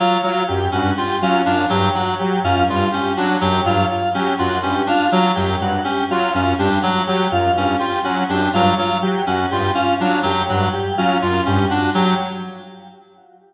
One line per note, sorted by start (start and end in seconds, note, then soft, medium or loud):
0.00 0.18 F#3 medium
0.00 0.20 F4 medium
0.23 0.43 F#3 medium
0.23 0.44 F#3 medium
0.23 0.44 F4 medium
0.48 0.68 F#2 medium
0.48 0.68 G4 medium
0.72 0.93 G2 medium
0.72 0.91 C#4 medium
0.72 0.93 F#4 medium
0.97 1.17 F4 medium
0.97 1.17 G4 medium
1.22 1.41 F#3 medium
1.22 1.42 C#4 medium
1.22 1.42 F4 medium
1.46 1.66 F#2 medium
1.46 1.65 D4 medium
1.46 1.65 F4 medium
1.70 1.90 G2 medium
1.70 1.89 F#3 medium
1.70 1.89 G4 medium
1.95 2.15 F#3 medium
1.95 2.14 F#4 medium
2.19 2.39 F#3 medium
2.19 2.39 G4 medium
2.44 2.63 F#2 medium
2.44 2.64 C#4 medium
2.44 2.64 F4 medium
2.68 2.88 G2 medium
2.68 2.88 F4 medium
2.68 2.89 F4 medium
2.92 3.13 C#4 medium
2.92 3.11 G4 medium
3.17 3.36 F#3 medium
3.17 3.37 D4 medium
3.17 3.36 F#4 medium
3.41 3.61 F#2 medium
3.41 3.60 F#3 medium
3.41 3.61 G4 medium
3.66 3.85 G2 medium
3.66 3.85 F#3 medium
3.66 3.85 F4 medium
3.90 4.10 F4 medium
4.14 4.34 F#3 medium
4.14 4.34 C#4 medium
4.14 4.35 G4 medium
4.38 4.59 F#2 medium
4.38 4.58 F4 medium
4.38 4.59 F#4 medium
4.63 4.83 G2 medium
4.63 4.82 C#4 medium
4.63 4.83 G4 medium
4.87 5.06 D4 medium
4.87 5.08 F4 medium
5.12 5.32 F#3 medium
5.12 5.32 F4 medium
5.36 5.56 F#2 medium
5.36 5.56 F#3 medium
5.36 5.55 G4 medium
5.61 5.80 G2 medium
5.61 5.82 F#4 medium
5.84 6.04 C#4 medium
5.84 6.04 G4 medium
6.10 6.29 F#3 medium
6.10 6.30 F4 medium
6.10 6.31 F4 medium
6.34 6.54 F#2 medium
6.34 6.54 C#4 medium
6.34 6.53 F4 medium
6.59 6.78 G2 medium
6.59 6.79 D4 medium
6.59 6.78 G4 medium
6.82 7.02 F#3 medium
6.82 7.02 F#4 medium
7.07 7.27 F#3 medium
7.07 7.28 F#3 medium
7.07 7.27 G4 medium
7.31 7.51 F#2 medium
7.31 7.52 F4 medium
7.56 7.75 G2 medium
7.56 7.77 C#4 medium
7.56 7.75 F4 medium
7.79 7.99 F4 medium
7.79 7.99 G4 medium
8.04 8.24 F#3 medium
8.04 8.24 C#4 medium
8.04 8.24 F#4 medium
8.29 8.49 F#2 medium
8.29 8.49 D4 medium
8.29 8.49 G4 medium
8.54 8.73 G2 medium
8.54 8.74 F#3 medium
8.54 8.73 F4 medium
8.78 8.98 F#3 medium
8.78 8.98 F4 medium
9.02 9.22 F#3 medium
9.02 9.22 G4 medium
9.27 9.46 F#2 medium
9.27 9.46 C#4 medium
9.27 9.47 F#4 medium
9.51 9.71 G2 medium
9.51 9.71 F4 medium
9.51 9.71 G4 medium
9.75 9.94 C#4 medium
9.75 9.95 F4 medium
10.00 10.20 F#3 medium
10.00 10.20 D4 medium
10.00 10.19 F4 medium
10.23 10.44 F#2 medium
10.23 10.42 F#3 medium
10.23 10.44 G4 medium
10.49 10.69 G2 medium
10.49 10.69 F#3 medium
10.49 10.69 F#4 medium
10.73 10.93 G4 medium
10.98 11.17 F#3 medium
10.98 11.18 C#4 medium
10.98 11.17 F4 medium
11.22 11.42 F#2 medium
11.22 11.41 F4 medium
11.22 11.42 F4 medium
11.46 11.66 G2 medium
11.46 11.65 C#4 medium
11.46 11.67 G4 medium
11.70 11.90 D4 medium
11.70 11.89 F#4 medium
11.95 12.14 F#3 medium
11.95 12.14 G4 medium